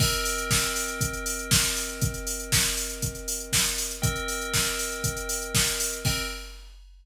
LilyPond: <<
  \new Staff \with { instrumentName = "Tubular Bells" } { \time 4/4 \key c \minor \tempo 4 = 119 <c' bes' ees'' g''>1~ | <c' bes' ees'' g''>1 | <c' bes' ees'' g''>1 | <c' bes' ees'' g''>4 r2. | }
  \new DrumStaff \with { instrumentName = "Drums" } \drummode { \time 4/4 <cymc bd>16 hh16 hho16 hh16 <bd sn>16 hh16 hho16 hh16 <hh bd>16 hh16 hho16 hh16 <bd sn>16 hh16 hho16 hh16 | <hh bd>16 hh16 hho16 hh16 <bd sn>16 hh16 hho16 hh16 <hh bd>16 hh16 hho16 hh16 <bd sn>16 hh16 hho16 hh16 | <hh bd>16 hh16 hho16 hh16 <bd sn>16 hh16 hho16 hh16 <hh bd>16 hh16 hho16 hh16 <bd sn>16 hh16 hho16 hh16 | <cymc bd>4 r4 r4 r4 | }
>>